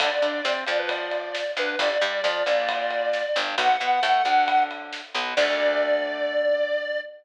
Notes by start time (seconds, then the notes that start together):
0.00 D2 D4 A4 D5, kick, ride
0.22 D3 D4, ride
0.45 C3 C4, snare
0.67 F2 F3 D5, ride
0.79 B4
0.89 D5, kick, ride
1.11 ride
1.35 snare
1.57 D2 D3 B4, ride
1.79 G1 D4 G4 D5, kick, ride
2.01 G2 G3, ride
2.24 F2 F3, snare
2.46 A#1 A#2, ride
2.69 kick, ride
2.91 ride
3.13 snare
3.36 G1 G2, ride
3.58 B1 B3 F#4 F#5, kick, ride
3.80 B2 B3, ride
4.03 A2 A3, snare
4.25 D2 D3, ride
4.48 kick, ride
4.71 ride
4.93 snare
5.15 B1 B2, ride
5.36 D2 D3 A3 D5, kick, crash